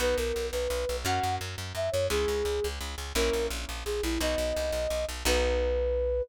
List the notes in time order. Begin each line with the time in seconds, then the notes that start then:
0.00 B1 B3 D#4 F#4 B4
0.17 B1 A#4
0.36 B1
0.52 B1 B4
0.70 B1
0.89 B1
1.05 F#2 A#3 C#4 F#4 F#5
1.23 F#2
1.41 F#2
1.58 F#2
1.75 F#2 E5
1.92 F#2 C#5
2.10 C#2 G#3 C#4 E4 G#4
2.28 C#2
2.45 C#2
2.64 C#2
2.81 C#2
2.98 C#2
3.15 A#1 A#3 C#4 E4 A#4
3.33 A#1
3.50 A#1
3.69 A#1
3.85 A#1 G#4
4.03 A#1 E4
4.20 B1 B3 D#4 F#4 D#5
4.38 B1
4.56 C2
4.72 B1
4.90 B1
5.09 B1
5.25 B1 B3 D#4 F#4 B4